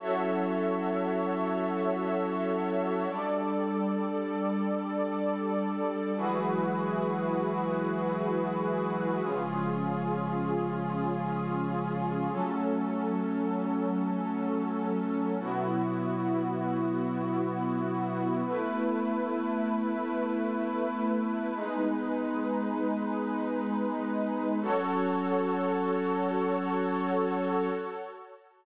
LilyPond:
<<
  \new Staff \with { instrumentName = "Pad 5 (bowed)" } { \time 4/4 \key fis \dorian \tempo 4 = 78 <fis cis' e' a'>1 | <g d' a'>1 | <e fis gis b'>1 | <cis eis gis>1 |
<fis a cis'>1 | <b, fis e'>1 | <a b e'>1 | <gis b dis'>1 |
<fis cis' a'>1 | }
  \new Staff \with { instrumentName = "Pad 2 (warm)" } { \time 4/4 \key fis \dorian <fis' a' cis'' e''>1 | <g a' d''>1 | <e' fis' gis' b'>1 | <cis' eis' gis'>1 |
<fis cis' a'>1 | <b e' fis'>1 | <a e' b'>1 | <gis dis' b'>1 |
<fis' a' cis''>1 | }
>>